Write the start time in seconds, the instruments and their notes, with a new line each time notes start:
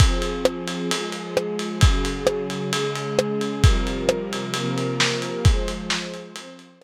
0.00 string ensemble 1 F3 C4 G#4, kick, ride
0.22 ride
0.45 cross-stick
0.68 ride
0.91 string ensemble 1 F3 G#3 G#4, ride
1.12 ride
1.37 cross-stick
1.59 ride
1.81 string ensemble 1 C#3 F#3 G#4, kick, ride
2.05 ride
2.27 cross-stick
2.50 ride
2.73 string ensemble 1 C#3 G#3 G#4, ride
2.96 ride
3.19 cross-stick
3.41 ride
3.64 string ensemble 1 C3 F3 G3 A#4, kick, ride
3.87 ride
4.09 cross-stick
4.33 ride
4.54 string ensemble 1 C3 F3 A#3 A#4, ride
4.78 ride
5.00 snare
5.22 ride
5.45 string ensemble 1 F3 G#3 C5, kick, ride
5.68 ride
5.90 snare
6.14 ride
6.36 string ensemble 1 F3 C4 C5, ride
6.59 ride
6.82 cross-stick